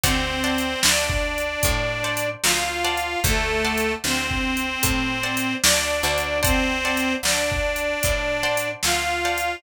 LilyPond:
<<
  \new Staff \with { instrumentName = "Harmonica" } { \time 4/4 \key d \major \tempo 4 = 75 <c' c''>4 <d' d''>2 <f' f''>4 | <a a'>4 <c' c''>2 <d' d''>4 | <c' c''>4 <d' d''>2 <f' f''>4 | }
  \new Staff \with { instrumentName = "Acoustic Guitar (steel)" } { \time 4/4 \key d \major <c'' d'' fis'' a''>8 <c'' d'' fis'' a''>2 <c'' d'' fis'' a''>4 <c'' d'' fis'' a''>8~ | <c'' d'' fis'' a''>8 <c'' d'' fis'' a''>2 <c'' d'' fis'' a''>4 <c'' d'' fis'' a''>8 | <c'' d'' fis'' a''>8 <c'' d'' fis'' a''>2 <c'' d'' fis'' a''>4 <c'' d'' fis'' a''>8 | }
  \new Staff \with { instrumentName = "Electric Bass (finger)" } { \clef bass \time 4/4 \key d \major d,4 d,4 a,4 d,4 | d,4 d,4 a,4 d,8 d,8~ | d,4 d,4 a,4 d,4 | }
  \new DrumStaff \with { instrumentName = "Drums" } \drummode { \time 4/4 \tuplet 3/2 { <hh bd>8 r8 hh8 sn8 bd8 hh8 <hh bd>8 r8 hh8 sn8 r8 hh8 } | \tuplet 3/2 { <hh bd>8 r8 hh8 sn8 bd8 hh8 <hh bd>8 r8 hh8 sn8 r8 hh8 } | \tuplet 3/2 { <hh bd>8 r8 hh8 sn8 bd8 hh8 <hh bd>8 r8 hh8 sn8 r8 hh8 } | }
>>